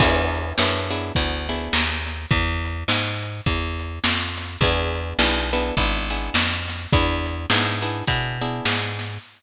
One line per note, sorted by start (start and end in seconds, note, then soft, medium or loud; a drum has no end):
0.00 0.53 E2 loud
0.00 0.54 B3 loud
0.00 0.54 D4 loud
0.00 0.54 E4 loud
0.00 0.54 G#4 loud
0.00 kick loud
0.00 crash loud
0.34 closed hi-hat medium
0.58 1.12 F#2 medium
0.58 0.90 B3 loud
0.58 0.90 D4 medium
0.58 0.90 E4 medium
0.58 0.90 G#4 medium
0.58 snare loud
0.91 1.13 B3 loud
0.91 1.13 D4 medium
0.91 1.13 E4 medium
0.91 1.13 G#4 loud
0.91 closed hi-hat medium
1.15 1.69 D2 medium
1.15 1.47 B3 medium
1.15 1.47 D4 medium
1.15 1.47 E4 medium
1.15 1.47 G#4 medium
1.15 kick medium
1.15 closed hi-hat loud
1.49 2.25 B3 medium
1.49 2.25 D4 medium
1.49 2.25 E4 medium
1.49 2.25 G#4 medium
1.49 closed hi-hat medium
1.73 2.26 D#2 medium
1.73 snare loud
2.06 snare soft
2.06 closed hi-hat medium
2.31 2.84 E2 loud
2.31 kick loud
2.31 closed hi-hat loud
2.65 closed hi-hat medium
2.88 3.41 G#2 medium
2.88 snare loud
3.22 closed hi-hat medium
3.46 3.99 E2 medium
3.46 kick medium
3.46 closed hi-hat loud
3.80 closed hi-hat medium
4.04 4.57 F2 medium
4.04 snare loud
4.37 snare medium
4.37 closed hi-hat medium
4.61 5.14 E2 loud
4.61 5.17 B3 loud
4.61 5.17 D4 loud
4.61 5.17 E4 loud
4.61 5.17 G#4 loud
4.61 kick loud
4.61 closed hi-hat loud
4.95 closed hi-hat medium
5.19 5.72 B1 medium
5.19 5.50 B3 medium
5.19 5.50 D4 loud
5.19 5.50 E4 medium
5.19 5.50 G#4 medium
5.19 snare loud
5.53 5.75 B3 loud
5.53 5.75 D4 loud
5.53 5.75 E4 loud
5.53 5.75 G#4 medium
5.53 closed hi-hat medium
5.77 6.30 G#1 medium
5.77 6.09 B3 medium
5.77 6.09 D4 loud
5.77 6.09 E4 loud
5.77 6.09 G#4 medium
5.77 kick medium
5.77 closed hi-hat loud
6.10 6.86 B3 medium
6.10 6.86 D4 medium
6.10 6.86 E4 medium
6.10 6.86 G#4 medium
6.10 closed hi-hat medium
6.34 6.87 F2 medium
6.34 snare loud
6.68 snare medium
6.68 closed hi-hat medium
6.92 7.46 E2 loud
6.92 7.47 B3 loud
6.92 7.47 D4 loud
6.92 7.47 E4 loud
6.92 7.47 G#4 loud
6.92 kick loud
6.92 closed hi-hat loud
7.26 closed hi-hat medium
7.50 8.03 G#2 medium
7.50 7.82 B3 medium
7.50 7.82 D4 loud
7.50 7.82 E4 loud
7.50 7.82 G#4 loud
7.50 snare loud
7.82 8.04 B3 medium
7.82 8.04 D4 medium
7.82 8.04 E4 medium
7.82 8.04 G#4 medium
7.82 closed hi-hat medium
8.07 8.61 B2 medium
8.07 8.38 B3 medium
8.07 8.38 D4 medium
8.07 8.38 E4 loud
8.07 8.38 G#4 medium
8.07 kick medium
8.07 closed hi-hat loud
8.41 9.17 B3 medium
8.41 9.17 D4 medium
8.41 9.17 E4 medium
8.41 9.17 G#4 medium
8.41 closed hi-hat medium
8.65 9.18 G#2 medium
8.65 snare loud
8.99 snare medium
8.99 closed hi-hat medium